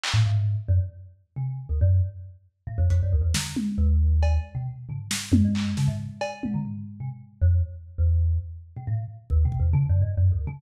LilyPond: <<
  \new Staff \with { instrumentName = "Kalimba" } { \clef bass \time 4/4 \tempo 4 = 136 r16 a,16 aes,8. r16 ges,16 r4 r16 c8. d,16 | ges,8 r4. a,16 f,16 f,16 ges,16 d,16 e,16 d8 | r8 ees,4. r16 b,16 r8 des16 r8. | ges,16 g,8. des16 aes,8 r8. bes,16 d16 r8. c16 |
r8. f,8 r8. e,4 r8. b,16 | a,8 r8 \tuplet 3/2 { ees,8 b,8 e,8 des8 ges,8 g,8 ges,8 d,8 des8 } | }
  \new DrumStaff \with { instrumentName = "Drums" } \drummode { \time 4/4 hc4 r4 r4 r4 | r4 r4 r8 hh8 r8 sn8 | tommh4 r8 cb8 r4 tomfh8 sn8 | tommh8 hc8 sn4 cb8 tommh8 tomfh4 |
r4 r4 r4 r4 | r4 bd8 bd8 r4 r4 | }
>>